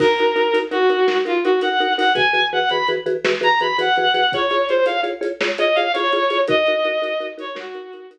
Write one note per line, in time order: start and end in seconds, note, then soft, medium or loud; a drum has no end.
0.00 0.07 D#4 medium
0.00 0.07 F#4 medium
0.00 0.58 A#4 medium
0.00 0.07 A#4 medium
0.00 kick loud
0.00 crash loud
0.18 0.27 D#4 medium
0.18 0.27 F#4 medium
0.18 0.27 A#4 medium
0.18 closed hi-hat medium
0.36 0.43 D#4 medium
0.36 0.43 F#4 medium
0.36 0.43 A#4 medium
0.36 closed hi-hat medium
0.53 0.61 D#4 medium
0.53 0.61 F#4 medium
0.53 0.61 A#4 medium
0.53 closed hi-hat loud
0.71 0.78 D#4 medium
0.71 0.78 F#4 medium
0.71 1.18 F#4 medium
0.71 0.78 A#4 medium
0.71 closed hi-hat medium
0.89 0.97 D#4 medium
0.89 0.97 F#4 medium
0.89 0.97 A#4 medium
0.89 closed hi-hat medium
1.07 1.15 D#4 medium
1.07 1.15 F#4 medium
1.07 1.15 A#4 medium
1.07 snare loud
1.25 1.32 D#4 medium
1.25 1.40 F4 medium
1.25 1.32 F#4 medium
1.25 1.32 A#4 medium
1.25 closed hi-hat medium
1.44 1.52 D#4 medium
1.44 1.59 F#4 medium
1.44 1.52 F#4 medium
1.44 1.52 A#4 medium
1.44 closed hi-hat medium
1.61 1.69 D#4 medium
1.61 1.69 F#4 medium
1.61 1.69 A#4 medium
1.61 1.93 F#5 medium
1.61 closed hi-hat loud
1.80 1.87 D#4 medium
1.80 1.87 F#4 medium
1.80 1.87 A#4 medium
1.80 closed hi-hat medium
1.97 2.05 D#4 medium
1.97 2.05 F#4 medium
1.97 2.05 A#4 medium
1.97 2.13 F#5 medium
1.97 open hi-hat loud
2.15 2.22 E3 medium
2.15 2.22 F#4 medium
2.15 2.22 G#4 medium
2.15 2.22 B4 medium
2.15 2.45 G#5 medium
2.15 kick loud
2.15 closed hi-hat loud
2.33 2.40 E3 medium
2.33 2.40 F#4 medium
2.33 2.40 G#4 medium
2.33 2.40 B4 medium
2.33 closed hi-hat medium
2.53 2.60 E3 medium
2.53 2.60 F#4 medium
2.53 2.60 G#4 medium
2.53 2.60 B4 medium
2.53 2.69 F#5 medium
2.69 2.78 E3 medium
2.69 2.78 F#4 medium
2.69 2.78 G#4 medium
2.69 2.78 B4 medium
2.69 2.87 B5 medium
2.69 closed hi-hat medium
2.88 2.96 E3 medium
2.88 2.96 F#4 medium
2.88 2.96 G#4 medium
2.88 2.96 B4 medium
2.88 closed hi-hat medium
3.06 3.13 E3 medium
3.06 3.13 F#4 medium
3.06 3.13 G#4 medium
3.06 3.13 B4 medium
3.06 closed hi-hat medium
3.24 3.32 E3 medium
3.24 3.32 F#4 medium
3.24 3.32 G#4 medium
3.24 3.32 B4 medium
3.24 snare loud
3.41 3.48 E3 medium
3.41 3.48 F#4 medium
3.41 3.48 G#4 medium
3.41 3.48 B4 medium
3.41 3.59 A#5 medium
3.41 closed hi-hat medium
3.60 3.68 E3 medium
3.60 3.68 F#4 medium
3.60 3.68 G#4 medium
3.60 3.68 B4 medium
3.60 3.77 B5 medium
3.60 closed hi-hat medium
3.78 3.85 E3 medium
3.78 3.85 F#4 medium
3.78 3.85 G#4 medium
3.78 3.85 B4 medium
3.78 4.32 F#5 medium
3.78 closed hi-hat loud
3.96 4.05 E3 medium
3.96 4.05 F#4 medium
3.96 4.05 G#4 medium
3.96 4.05 B4 medium
3.96 closed hi-hat medium
4.14 4.21 E3 medium
4.14 4.21 F#4 medium
4.14 4.21 G#4 medium
4.14 4.21 B4 medium
4.14 closed hi-hat loud
4.32 4.41 F4 medium
4.32 4.41 G#4 medium
4.32 4.65 C#5 medium
4.32 4.41 C#5 medium
4.32 kick loud
4.32 closed hi-hat loud
4.50 4.58 F4 medium
4.50 4.58 G#4 medium
4.50 4.58 C#5 medium
4.50 closed hi-hat medium
4.69 4.77 F4 medium
4.69 4.77 G#4 medium
4.69 4.85 C5 medium
4.69 4.77 C#5 medium
4.69 closed hi-hat medium
4.86 4.93 F4 medium
4.86 4.93 G#4 medium
4.86 4.93 C#5 medium
4.86 5.01 F5 medium
4.86 closed hi-hat loud
5.03 5.10 F4 medium
5.03 5.10 G#4 medium
5.03 5.10 C#5 medium
5.03 closed hi-hat medium
5.21 5.28 F4 medium
5.21 5.28 G#4 medium
5.21 5.28 C#5 medium
5.21 closed hi-hat loud
5.41 5.48 F4 medium
5.41 5.48 G#4 medium
5.41 5.48 C#5 medium
5.41 snare loud
5.58 5.66 F4 medium
5.58 5.66 G#4 medium
5.58 5.66 C#5 medium
5.58 5.76 D#5 medium
5.58 closed hi-hat loud
5.75 5.84 F4 medium
5.75 5.84 G#4 medium
5.75 5.84 C#5 medium
5.75 5.92 F5 medium
5.75 closed hi-hat medium
5.93 6.03 F4 medium
5.93 6.03 G#4 medium
5.93 6.40 C#5 medium
5.93 6.03 C#5 medium
5.93 closed hi-hat loud
6.13 6.20 F4 medium
6.13 6.20 G#4 medium
6.13 6.20 C#5 medium
6.13 closed hi-hat medium
6.30 6.37 F4 medium
6.30 6.37 G#4 medium
6.30 6.37 C#5 medium
6.30 closed hi-hat medium
6.48 6.55 D#4 medium
6.48 6.55 F#4 medium
6.48 6.55 A#4 medium
6.48 7.26 D#5 loud
6.48 kick loud
6.48 closed hi-hat loud
6.66 6.75 D#4 medium
6.66 6.75 F#4 medium
6.66 6.75 A#4 medium
6.66 closed hi-hat medium
6.85 6.92 D#4 medium
6.85 6.92 F#4 medium
6.85 6.92 A#4 medium
6.85 closed hi-hat medium
7.02 7.09 D#4 medium
7.02 7.09 F#4 medium
7.02 7.09 A#4 medium
7.02 closed hi-hat loud
7.20 7.27 D#4 medium
7.20 7.27 F#4 medium
7.20 7.27 A#4 medium
7.20 closed hi-hat medium
7.37 7.45 D#4 medium
7.37 7.45 F#4 medium
7.37 7.45 A#4 medium
7.37 7.56 C#5 medium
7.37 closed hi-hat loud
7.55 7.62 D#4 medium
7.55 7.62 F#4 medium
7.55 8.06 F#4 medium
7.55 7.62 A#4 medium
7.55 snare loud
7.74 7.82 D#4 medium
7.74 7.82 F#4 medium
7.74 7.82 A#4 medium
7.74 closed hi-hat medium
7.93 8.01 D#4 medium
7.93 8.01 F#4 medium
7.93 8.01 A#4 medium
7.93 closed hi-hat loud
8.11 8.18 D#4 medium
8.11 8.18 F#4 medium
8.11 8.18 A#4 medium
8.11 closed hi-hat loud